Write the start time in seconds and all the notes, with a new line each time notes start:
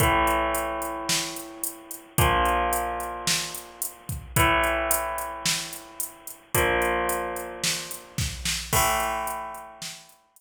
0.00 A2 E3 A3, kick, closed hi-hat
0.27 closed hi-hat
0.55 closed hi-hat
0.82 closed hi-hat
1.09 snare
1.36 closed hi-hat
1.64 closed hi-hat
1.91 closed hi-hat
2.18 A#2 F3 A#3, kick, closed hi-hat
2.45 closed hi-hat
2.73 closed hi-hat
3.00 closed hi-hat
3.27 snare
3.55 closed hi-hat
3.82 closed hi-hat
4.09 kick, closed hi-hat
4.36 A2 E3 A3, kick, closed hi-hat
4.64 closed hi-hat
4.91 closed hi-hat
5.18 closed hi-hat
5.46 snare
5.73 closed hi-hat
6.00 closed hi-hat
6.27 closed hi-hat
6.55 A#2 F3 A#3, kick, closed hi-hat
6.82 closed hi-hat
7.09 closed hi-hat
7.36 closed hi-hat
7.64 snare
7.91 closed hi-hat
8.18 kick, snare
8.45 snare
8.73 A2 E3 A3, kick, crash
9.00 closed hi-hat
9.27 closed hi-hat
9.55 closed hi-hat
9.82 snare
10.09 closed hi-hat
10.36 closed hi-hat